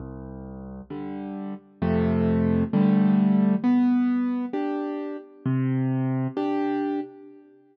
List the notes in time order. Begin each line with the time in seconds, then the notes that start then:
0.00 C2
0.90 D3 G3
1.82 F2 C3 A3
2.73 D3 G3 A3
3.64 B3
4.53 D4 G4
5.46 C3
6.37 D4 G4